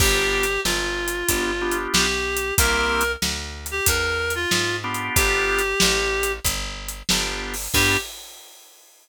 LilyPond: <<
  \new Staff \with { instrumentName = "Clarinet" } { \time 4/4 \key g \major \tempo 4 = 93 g'4 f'2 g'4 | bes'4 r8. g'16 bes'8. f'8. r8 | g'2 r2 | g'4 r2. | }
  \new Staff \with { instrumentName = "Drawbar Organ" } { \time 4/4 \key g \major <b d' f' g'>2 <b d' f' g'>8 <b d' f' g'>4. | <bes c' e' g'>2.~ <bes c' e' g'>8 <b d' f' g'>8~ | <b d' f' g'>2. <b d' f' g'>4 | <b d' f' g'>4 r2. | }
  \new Staff \with { instrumentName = "Electric Bass (finger)" } { \clef bass \time 4/4 \key g \major g,,4 g,,4 g,,4 b,,4 | c,4 d,4 e,4 gis,4 | g,,4 a,,4 g,,4 g,,4 | g,4 r2. | }
  \new DrumStaff \with { instrumentName = "Drums" } \drummode { \time 4/4 \tuplet 3/2 { <cymc bd>8 r8 hh8 sn8 r8 hh8 <hh bd>8 r8 hh8 sn8 r8 hh8 } | \tuplet 3/2 { <hh bd>8 r8 hh8 sn8 r8 hh8 <hh bd>8 r8 hh8 sn8 r8 hh8 } | \tuplet 3/2 { <hh bd>8 r8 hh8 sn8 r8 hh8 <hh bd>8 r8 hh8 sn8 r8 hho8 } | <cymc bd>4 r4 r4 r4 | }
>>